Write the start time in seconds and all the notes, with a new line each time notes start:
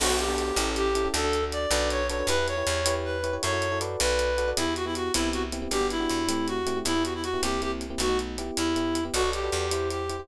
0.00 B1 B3 D4 F#4 A4, crash
0.09 B3 D4 F#4 A4
0.19 G4, closed hi-hat
0.28 B3 D4 F#4 A4
0.38 closed hi-hat
0.56 A1 C#4 E4 G4 A4, closed hi-hat
0.76 G4, closed hi-hat
0.95 C#4 E4 G4 A4, closed hi-hat
1.05 C#4 E4 G4 A4
1.14 D2 D4 F#4 A4, closed hi-hat
1.24 D4 F#4 A4
1.33 closed hi-hat
1.43 D4 F#4 A4
1.52 D5, closed hi-hat
1.71 B1 D4 F#4 A4 B4, closed hi-hat
1.90 C#5, closed hi-hat
2.09 D4 F#4 A4 B4 C#5, closed hi-hat
2.19 D4 F#4 A4 B4
2.27 E2 E4 G4 B4, closed hi-hat
2.38 E4 G4 B4
2.48 C#5, closed hi-hat
2.57 E4 G4 B4
2.67 E2, closed hi-hat
2.86 E4 G4 B4 C#5, closed hi-hat
3.04 B4
3.23 E4 G4 B4 C#5, closed hi-hat
3.33 E4 G4 B4 C#5
3.43 F#2 E4 F#4 A4 C#5, closed hi-hat
3.53 E4 F#4 A4 C#5
3.62 closed hi-hat
3.72 E4 F#4 A4 C#5
3.81 F#4 A4 B4 D5, closed hi-hat
4.00 B1 B4, closed hi-hat
4.19 closed hi-hat
4.38 F#4 A4 B4 D5, closed hi-hat
4.48 F#4 A4 B4 D5
4.57 E2 B3 E4 G4, closed hi-hat
4.66 B3 E4 G4
4.76 F#4, closed hi-hat
4.85 B3 E4 G4
4.95 F#4, closed hi-hat
5.14 C2 B3 C4 E4 G4, closed hi-hat
5.33 F#4, closed hi-hat
5.52 B3 C4 E4 G4, closed hi-hat
5.62 B3 C4 E4 G4
5.71 G1 B3 D4 F#4 G4, closed hi-hat
5.81 B3 D4 F#4 G4
5.90 E4, closed hi-hat
6.00 B3 D4 F#4 G4
6.10 E2, closed hi-hat
6.28 A3 C4 E4 G4, closed hi-hat
6.48 F#4, closed hi-hat
6.66 A3 C4 E4 G4, closed hi-hat
6.76 A3 C4 E4 G4
6.85 E2 B3 E4 G4, closed hi-hat
6.95 B3 E4 G4
7.04 F#4, closed hi-hat
7.14 E4
7.23 F#4, closed hi-hat
7.33 B3 E4 G4
7.43 C2 A#3 C4 E4 G4, closed hi-hat
7.62 A#3 C4 E4 G4, closed hi-hat
7.81 closed hi-hat
7.90 A#3 C4 E4 G4
7.98 B1 A3 B3 D#4 F#4, closed hi-hat
8.09 A3 B3 D#4 F#4
8.19 closed hi-hat
8.38 B3 E4 G4, closed hi-hat
8.57 E2 E4, closed hi-hat
8.76 B3 E4 G4, closed hi-hat
8.95 closed hi-hat
9.05 B3 E4 G4
9.14 B1 F#4 A4 B4 D5, closed hi-hat
9.23 F#4 A4 B4 D5
9.33 G4, closed hi-hat
9.43 F#4 A4 B4 D5
9.52 E2, closed hi-hat
9.71 E4 G4 C5, closed hi-hat
9.90 G4, closed hi-hat
10.09 E4 G4 C5, closed hi-hat
10.19 E4 G4 C5